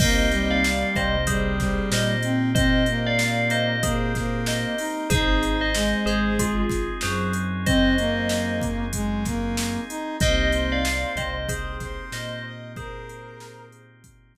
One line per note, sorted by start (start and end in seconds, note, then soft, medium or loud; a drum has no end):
0.00 0.84 C2 loud
0.00 0.29 A#3 loud
0.00 0.59 A#3 medium
0.00 5.07 A#3 medium
0.00 0.59 C4 loud
0.00 5.07 C4 medium
0.00 0.59 D#4 medium
0.00 5.07 D#4 medium
0.00 0.59 G4 medium
0.00 5.07 G4 medium
0.00 0.48 C5 medium
0.00 0.48 D#5 loud
0.00 kick loud
0.00 crash loud
0.32 1.16 G3 loud
0.32 closed hi-hat medium
0.51 0.91 D5 medium
0.51 0.91 F5 loud
0.64 snare loud
0.96 1.81 C2 medium
0.96 1.80 C3 medium
0.96 1.24 C5 loud
0.96 1.24 D#5 loud
0.96 kick medium
0.96 closed hi-hat medium
1.27 1.59 G3 loud
1.27 1.89 G#4 medium
1.27 1.89 C5 loud
1.27 kick medium
1.27 closed hi-hat loud
1.60 2.16 G3 loud
1.60 kick medium
1.60 snare medium
1.60 closed hi-hat medium
1.91 4.65 A#2 loud
1.91 4.66 A#3 medium
1.91 2.22 C5 medium
1.91 2.22 D#5 loud
1.91 snare loud
2.23 2.50 C4 loud
2.23 closed hi-hat medium
2.55 2.83 C4 loud
2.55 2.97 C5 loud
2.55 2.97 D#5 loud
2.55 kick loud
2.55 closed hi-hat loud
2.86 3.76 A#3 medium
2.86 closed hi-hat medium
3.07 3.48 D5 loud
3.07 3.48 F5 loud
3.19 snare loud
3.50 3.82 C5 loud
3.50 3.82 D#5 loud
3.50 closed hi-hat medium
3.83 4.13 A#3 loud
3.83 4.39 G#4 medium
3.83 4.39 C5 loud
3.83 kick loud
3.83 closed hi-hat loud
4.15 4.75 A#3 loud
4.15 kick medium
4.15 snare medium
4.15 closed hi-hat medium
4.46 4.79 C5 medium
4.46 4.79 D#5 medium
4.46 snare loud
4.78 5.08 D#4 loud
4.78 open hi-hat medium
5.10 5.94 G#1 loud
5.10 5.69 C4 medium
5.10 10.17 C4 medium
5.10 5.69 D#4 medium
5.10 5.69 D#4 loud
5.10 10.17 D#4 medium
5.10 5.55 G#4 loud
5.10 5.69 G#4 medium
5.10 10.17 G#4 medium
5.10 5.55 C5 loud
5.10 kick loud
5.10 closed hi-hat loud
5.43 closed hi-hat medium
5.61 5.99 C5 loud
5.61 5.99 D#5 loud
5.75 6.63 G#3 loud
5.75 snare loud
6.06 6.90 G#1 loud
6.06 6.91 G#3 medium
6.06 6.35 G#4 loud
6.06 6.35 C5 loud
6.06 closed hi-hat medium
6.39 6.94 F4 medium
6.39 6.94 G#4 loud
6.39 kick medium
6.39 closed hi-hat loud
6.69 kick medium
6.69 snare medium
6.69 closed hi-hat medium
7.01 9.78 F#2 loud
7.01 9.77 F#3 medium
7.01 7.33 G#4 medium
7.01 7.33 C5 medium
7.01 snare loud
7.33 closed hi-hat medium
7.66 7.93 C4 loud
7.66 8.55 C5 loud
7.66 8.55 D#5 loud
7.66 kick loud
7.66 closed hi-hat loud
7.98 8.85 A#3 loud
7.98 closed hi-hat medium
8.29 snare loud
8.61 kick medium
8.61 closed hi-hat medium
8.93 9.24 G#3 medium
8.93 kick medium
8.93 closed hi-hat loud
9.25 9.81 A#3 loud
9.25 kick medium
9.25 snare medium
9.25 closed hi-hat medium
9.57 snare loud
9.89 10.16 D#4 loud
9.89 closed hi-hat medium
10.20 11.05 C2 loud
10.20 10.80 A#3 medium
10.20 14.37 A#3 medium
10.20 10.80 C4 medium
10.20 14.37 C4 medium
10.20 10.80 D#4 medium
10.20 14.37 D#4 medium
10.20 10.80 G4 medium
10.20 14.37 G4 medium
10.20 10.70 C5 loud
10.20 10.49 D#5 loud
10.20 10.70 D#5 loud
10.20 kick loud
10.20 closed hi-hat loud
10.52 11.35 C5 medium
10.52 closed hi-hat medium
10.72 11.11 D5 loud
10.72 11.11 F5 loud
10.85 snare loud
11.16 12.00 C2 loud
11.16 12.01 C3 medium
11.16 11.48 C5 medium
11.16 11.48 D#5 loud
11.16 kick medium
11.16 closed hi-hat medium
11.49 12.04 G#4 medium
11.49 11.76 C5 medium
11.49 12.04 C5 loud
11.49 kick loud
11.49 closed hi-hat loud
11.80 12.43 C5 loud
11.80 kick medium
11.80 snare medium
11.80 closed hi-hat medium
12.12 14.37 A#2 medium
12.12 14.37 A#3 medium
12.12 12.44 C5 loud
12.12 12.44 D#5 loud
12.12 snare loud
12.45 12.72 D#5 medium
12.76 13.82 G#4 loud
12.76 13.66 A#4 loud
12.76 13.82 C5 loud
12.76 kick loud
12.76 closed hi-hat medium
13.09 closed hi-hat medium
13.40 snare loud
13.72 closed hi-hat medium
14.04 kick medium
14.04 closed hi-hat loud
14.35 kick medium
14.35 snare medium
14.35 closed hi-hat medium